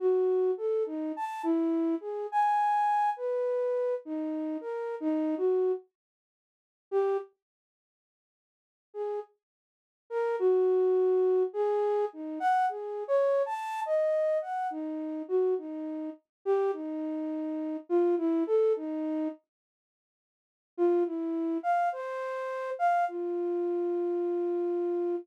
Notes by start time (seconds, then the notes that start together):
0.00 F#4
0.57 A4
0.86 D#4
1.16 A5
1.43 E4
2.00 G#4
2.32 G#5
3.17 B4
4.05 D#4
4.61 A#4
5.00 D#4
5.37 F#4
6.91 G4
8.94 G#4
10.10 A#4
10.39 F#4
11.53 G#4
12.13 D#4
12.40 F#5
12.69 G#4
13.08 C#5
13.46 A5
13.86 D#5
14.42 F#5
14.70 D#4
15.28 F#4
15.58 D#4
16.45 G4
16.73 D#4
17.89 F4
18.18 E4
18.47 A4
18.76 D#4
20.77 F4
21.06 E4
21.63 F5
21.92 C5
22.79 F5
23.08 F4